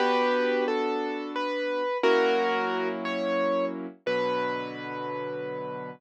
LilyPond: <<
  \new Staff \with { instrumentName = "Acoustic Grand Piano" } { \time 6/8 \key b \minor \tempo 4. = 59 <g' b'>4 a'4 b'4 | <fis' ais'>4. cis''4 r8 | b'2. | }
  \new Staff \with { instrumentName = "Acoustic Grand Piano" } { \time 6/8 \key b \minor <b d' fis'>2. | <fis ais cis' e'>2. | <b, d fis>2. | }
>>